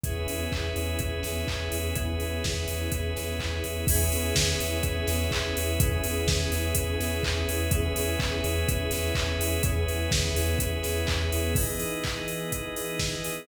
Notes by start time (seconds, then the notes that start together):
0.04 E2 B3 C#4 E4 G#4 B4 C#5 E5, kick, closed hi-hat
0.27 E2, open hi-hat
0.52 E2, kick, clap
0.76 E2, open hi-hat
0.99 E2, kick, closed hi-hat
1.23 E2, snare, open hi-hat
1.48 E2, kick, clap
1.72 E2, open hi-hat
1.95 E2 B3 C#4 E4 G#4 B4 C#5 E5, kick, closed hi-hat
2.20 E2, open hi-hat
2.44 E2, kick, snare
2.68 E2, open hi-hat
2.92 E2, kick, closed hi-hat
3.16 E2, snare, open hi-hat
3.39 E2, kick, clap
3.64 E2, open hi-hat
3.87 E2 B3 C#4 E4 G#4 B4 C#5 E5, kick, crash
4.11 E2, open hi-hat
4.35 E2, kick, snare
4.60 E2, open hi-hat
4.83 E2, kick, closed hi-hat
5.07 E2, snare, open hi-hat
5.31 E2, kick, clap
5.57 E2, open hi-hat
5.80 E2 B3 C#4 E4 G#4 B4 C#5 E5, kick, closed hi-hat
6.04 E2, open hi-hat
6.27 E2, kick, snare
6.52 E2, open hi-hat
6.75 E2, kick, closed hi-hat
7.00 E2, snare, open hi-hat
7.23 E2, kick, clap
7.48 E2, open hi-hat
7.71 E2 B3 C#4 E4 G#4 B4 C#5 E5, kick, closed hi-hat
7.96 E2, open hi-hat
8.20 E2, kick, clap
8.44 E2, open hi-hat
8.69 E2, kick, closed hi-hat
8.91 E2, snare, open hi-hat
9.15 E2, kick, clap
9.39 E2, open hi-hat
9.63 E2 B3 C#4 E4 G#4 B4 C#5 E5, kick, closed hi-hat
9.88 E2, open hi-hat
10.11 E2, kick, snare
10.35 E2, open hi-hat
10.59 E2, kick, closed hi-hat
10.83 E2, snare, open hi-hat
11.07 E2, kick, clap
11.32 E2, open hi-hat
11.55 E3 B3 D#4 E4 G#4 B4 D#5, kick, crash
11.80 open hi-hat
12.04 kick, clap
12.28 open hi-hat
12.52 kick, closed hi-hat
12.76 open hi-hat
13.00 kick, snare
13.24 open hi-hat